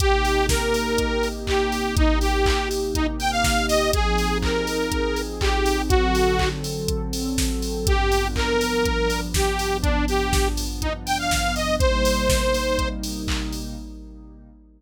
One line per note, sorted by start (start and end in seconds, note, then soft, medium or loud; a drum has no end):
0.00 3.89 C3 medium
0.00 3.89 A#3 medium
0.00 3.89 D#4 loud
0.00 3.89 G4 loud
0.00 0.46 G4 medium
0.00 kick medium
0.00 closed hi-hat medium
0.25 open hi-hat medium
0.49 1.28 A#4 medium
0.49 kick medium
0.49 snare medium
0.74 open hi-hat medium
0.98 kick medium
0.98 closed hi-hat medium
1.23 open hi-hat medium
1.47 1.95 G4 medium
1.47 kick medium
1.47 clap medium
1.72 open hi-hat medium
1.97 2.19 D#4 medium
1.97 kick loud
1.97 closed hi-hat medium
2.21 2.69 G4 medium
2.21 open hi-hat medium
2.46 kick medium
2.46 clap loud
2.71 open hi-hat medium
2.95 3.07 D#4 medium
2.95 kick medium
2.95 closed hi-hat medium
3.19 3.31 G5 medium
3.19 open hi-hat medium
3.31 3.66 F5 medium
3.44 kick medium
3.44 snare medium
3.68 3.91 D#5 medium
3.68 open hi-hat medium
3.93 5.88 F3 loud
3.93 5.88 C4 medium
3.93 5.88 D#4 loud
3.93 5.88 G#4 medium
3.93 4.38 G#4 medium
3.93 kick medium
3.93 closed hi-hat loud
4.18 open hi-hat medium
4.42 5.21 A#4 medium
4.42 kick medium
4.42 clap medium
4.67 open hi-hat medium
4.92 kick medium
4.92 closed hi-hat medium
5.16 open hi-hat medium
5.41 5.82 G4 medium
5.41 kick medium
5.41 clap loud
5.66 open hi-hat medium
5.89 7.85 D3 medium
5.89 7.85 F#3 loud
5.89 7.85 C4 loud
5.89 6.49 F#4 medium
5.89 7.85 A4 medium
5.89 kick medium
5.89 closed hi-hat medium
6.15 open hi-hat medium
6.39 kick medium
6.39 clap medium
6.64 open hi-hat medium
6.88 kick medium
6.88 closed hi-hat medium
7.13 open hi-hat medium
7.38 kick medium
7.38 snare medium
7.62 open hi-hat medium
7.87 11.77 G2 medium
7.87 11.77 F3 medium
7.87 11.77 B3 medium
7.87 11.77 D4 medium
7.87 8.28 G4 medium
7.87 kick medium
7.87 closed hi-hat medium
8.12 open hi-hat medium
8.36 9.20 A#4 medium
8.36 kick medium
8.36 clap medium
8.61 open hi-hat medium
8.85 kick medium
8.85 closed hi-hat medium
9.10 open hi-hat medium
9.34 9.77 G4 medium
9.34 kick medium
9.34 snare medium
9.59 open hi-hat medium
9.82 10.05 D4 medium
9.82 kick medium
9.82 closed hi-hat medium
10.08 10.48 G4 medium
10.08 open hi-hat medium
10.33 kick medium
10.33 snare medium
10.57 open hi-hat medium
10.82 10.93 D#4 medium
10.82 kick medium
10.82 closed hi-hat medium
11.06 11.18 G5 medium
11.06 open hi-hat medium
11.19 11.55 F5 medium
11.31 kick medium
11.31 snare medium
11.56 11.76 D#5 medium
11.56 open hi-hat medium
11.79 13.75 C3 loud
11.79 13.75 G3 medium
11.79 13.75 A#3 medium
11.79 13.75 D#4 medium
11.79 12.89 C5 medium
11.79 kick medium
11.79 closed hi-hat medium
12.05 open hi-hat medium
12.29 kick medium
12.29 snare medium
12.54 open hi-hat medium
12.79 kick medium
12.79 closed hi-hat medium
13.03 open hi-hat medium
13.28 kick medium
13.28 clap loud
13.53 open hi-hat medium